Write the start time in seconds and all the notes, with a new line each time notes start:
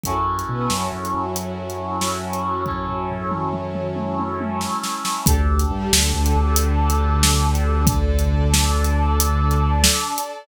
0.03 F#2 C#4 E4 F#4 A4, kick, closed hi-hat
0.39 closed hi-hat
0.49 B2 B3
0.70 F#2 F#3, snare
0.92 F#2 F#3
1.05 closed hi-hat
1.13 F#2 F#3
1.36 closed hi-hat
1.70 closed hi-hat
2.01 snare
2.33 closed hi-hat
2.66 C#4 E4 A4 C#5, kick, floor tom
2.88 floor tom
3.10 floor tom
3.31 mid tom
3.53 mid tom
3.75 mid tom
3.96 high tom
4.19 high tom
4.40 high tom
4.61 snare
4.83 snare
5.05 snare
5.25 D2 D4 G4 A4, kick, closed hi-hat
5.59 closed hi-hat
5.71 G2 G3
5.92 D2 D3, snare
6.14 D2 D3
6.26 closed hi-hat
6.35 D2 D3
6.56 closed hi-hat
6.90 closed hi-hat
7.23 snare
7.55 closed hi-hat
7.87 D4 A4 D5, kick, closed hi-hat
8.19 closed hi-hat
8.54 snare
8.84 closed hi-hat
9.20 closed hi-hat
9.51 closed hi-hat
9.84 snare
10.18 closed hi-hat